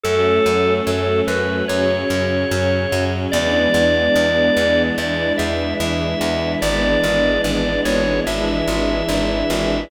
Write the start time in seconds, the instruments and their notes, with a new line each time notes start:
0.03 electric bass (finger) F#2, string ensemble 1 F#3 A3 C#4, drawbar organ A4
0.46 electric bass (finger) F#2
0.87 electric bass (finger) F#2, drawbar organ A4
1.27 electric bass (finger) F#2, drawbar organ B4
1.68 electric bass (finger) F#2, string ensemble 1 C#3 F#3 C#4, drawbar organ C#5
2.10 electric bass (finger) F#2
2.51 electric bass (finger) F#2
2.92 electric bass (finger) F#2
3.32 electric bass (finger) E2, string ensemble 1 E3 G#3 B3 D4, drawbar organ D5
3.74 electric bass (finger) E2
4.16 electric bass (finger) E2
4.57 electric bass (finger) E2
4.98 electric bass (finger) E2, string ensemble 1 E3 G#3 D4 E4, drawbar organ D5
5.38 electric bass (finger) E2, drawbar organ E5
5.80 electric bass (finger) E2, drawbar organ E5
6.21 electric bass (finger) E2
6.62 electric bass (finger) G#1, string ensemble 1 E3 G#3 B3 D4, drawbar organ D5
7.04 electric bass (finger) G#1
7.44 electric bass (finger) G#1, drawbar organ D5
7.85 electric bass (finger) G#1, drawbar organ C#5
8.27 electric bass (finger) G#1, string ensemble 1 E3 G#3 D4 E4, drawbar organ E5
8.68 electric bass (finger) G#1
9.09 electric bass (finger) G#1
9.50 electric bass (finger) G#1